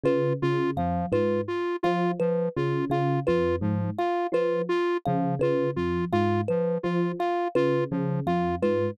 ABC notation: X:1
M:5/8
L:1/8
Q:1/4=84
K:none
V:1 name="Electric Piano 1" clef=bass
^C, C, F,, ^G,, z | F, z ^C, C, F,, | ^G,, z F, z ^C, | ^C, F,, ^G,, z F, |
z ^C, C, F,, ^G,, |]
V:2 name="Lead 1 (square)"
F F F, F F | F F, F F F | F, F F F F, | F F F F, F |
F F F, F F |]
V:3 name="Kalimba"
B z f B z | f B z f B | z f B z f | B z f B z |
f B z f B |]